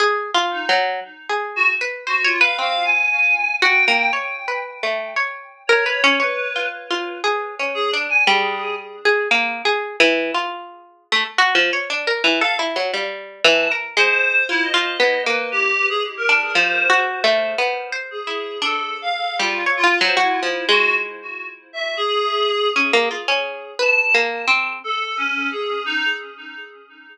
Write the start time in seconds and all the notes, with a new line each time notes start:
0.00 G#4
0.34 F4
0.51 D#4
0.69 F#3
1.29 G#4
1.56 F#4
1.81 B4
2.07 F#4 C5
2.24 F4 C#5
2.40 B4 F5
2.59 C4 F5
2.84 G#5
3.62 F#4 G5
3.88 A#3
4.13 C#5
4.48 B4
4.83 A3
5.16 C#5
5.67 A#4 C#5
5.86 B4
6.04 C#4
6.20 B4 C#5
6.56 F4
6.91 F4
7.24 G#4
7.59 C#4
7.74 G#4
7.91 D4
8.09 G#5
8.27 G3 G#4
9.05 G#4
9.31 A#3
9.65 G#4
10.00 E3
10.34 F4
11.12 A3
11.38 F#4
11.55 F3
11.73 C#5
11.90 D4
12.07 A#4
12.24 E3
12.41 A4 F5
12.59 E4
12.76 F#3
12.94 G3
13.44 E3 A5
13.71 A#4
13.97 G#3 C5
14.49 E4 F4
14.62 D#5
14.74 F4
15.00 B3
15.26 A#3 B4
15.52 G4
15.89 G#4
16.17 A#4
16.29 D4
16.54 F3 C5
16.90 F#4
17.24 A3
17.58 B3
17.92 C5
18.11 G#4
18.27 E4
18.62 D4 A4
19.02 F5
19.39 G3 F4
19.66 C#5
19.77 F4
19.84 F4
20.01 F#3 C5
20.17 E4 F#4
20.43 F3
20.69 G#3 F#4
21.73 E5
21.97 G#4
22.76 C#4
22.93 A#3
23.11 F4
23.28 C#4
23.79 B4 A5
24.14 A#3
24.48 C4
24.84 A4
25.17 C#4
25.51 G#4
25.86 D#4